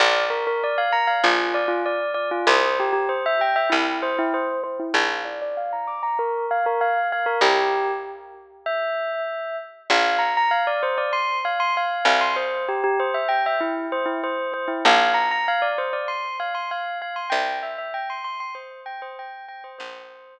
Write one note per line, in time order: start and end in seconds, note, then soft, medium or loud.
0.00 1.14 A#1 loud
0.00 0.25 D5 medium
0.30 0.45 A#4 medium
0.47 0.62 A#4 medium
0.64 0.78 D5 medium
0.78 0.93 F5 medium
0.93 1.07 A#5 medium
1.07 1.22 F5 medium
1.24 2.37 A#1 medium
1.24 1.53 F4 medium
1.54 1.69 D5 medium
1.68 1.83 F4 medium
1.86 2.12 D5 medium
2.14 2.29 D5 medium
2.31 2.46 F4 medium
2.47 3.61 C2 loud
2.47 2.77 C5 medium
2.80 2.92 G4 medium
2.93 3.07 G4 medium
3.09 3.24 C5 medium
3.26 3.41 E5 medium
3.41 3.56 G5 medium
3.56 3.71 E5 medium
3.70 4.86 C2 medium
3.70 3.99 E4 medium
4.02 4.17 C5 medium
4.19 4.33 E4 medium
4.34 4.61 C5 medium
4.64 4.78 C5 medium
4.80 4.94 E4 medium
4.94 7.22 A#1 medium
4.94 5.22 F5 medium
5.25 5.39 D5 medium
5.42 5.56 D5 medium
5.57 5.72 F5 medium
5.73 5.87 A#5 medium
5.87 6.02 D6 medium
6.03 6.18 A#5 medium
6.19 6.45 A#4 medium
6.51 6.65 F5 medium
6.66 6.81 A#4 medium
6.81 7.07 F5 medium
7.12 7.27 F5 medium
7.26 7.41 A#4 medium
7.41 9.69 C2 loud
7.41 7.91 G4 medium
8.66 9.56 E5 medium
9.90 11.95 A#1 loud
9.90 10.21 F5 medium
10.19 10.33 A#5 medium
10.37 10.52 A#5 medium
10.51 10.66 F5 medium
10.67 10.82 D5 medium
10.83 10.97 C5 medium
10.98 11.12 D5 medium
11.13 11.39 C6 medium
11.45 11.60 F5 medium
11.60 11.74 C6 medium
11.77 12.06 F5 medium
12.05 14.64 C2 loud
12.05 12.21 F5 medium
12.21 12.36 C6 medium
12.36 12.65 C5 medium
12.69 12.83 G4 medium
12.84 12.98 G4 medium
13.00 13.14 C5 medium
13.14 13.29 E5 medium
13.29 13.43 G5 medium
13.46 13.61 E5 medium
13.60 13.86 E4 medium
13.92 14.07 C5 medium
14.06 14.20 E4 medium
14.24 14.52 C5 medium
14.54 14.68 C5 medium
14.68 14.82 E4 medium
14.85 17.13 A#1 loud
14.85 15.12 F5 medium
15.14 15.29 A#5 medium
15.31 15.46 A#5 medium
15.48 15.63 F5 medium
15.62 15.77 D5 medium
15.78 15.93 C5 medium
15.93 16.08 D5 medium
16.08 16.36 C6 medium
16.40 16.54 F5 medium
16.55 16.69 C6 medium
16.71 16.98 F5 medium
17.02 17.16 F5 medium
17.16 17.31 C6 medium
17.30 19.59 C2 loud
17.30 17.58 G5 medium
17.63 17.77 E5 medium
17.78 17.93 E5 medium
17.94 18.09 G5 medium
18.10 18.24 C6 medium
18.24 18.39 C6 medium
18.40 18.55 C6 medium
18.55 18.80 C5 medium
18.86 19.01 G5 medium
19.02 19.17 C5 medium
19.19 19.45 G5 medium
19.48 19.63 G5 medium
19.64 19.78 C5 medium
19.78 20.39 A#1 loud
19.78 20.39 C5 medium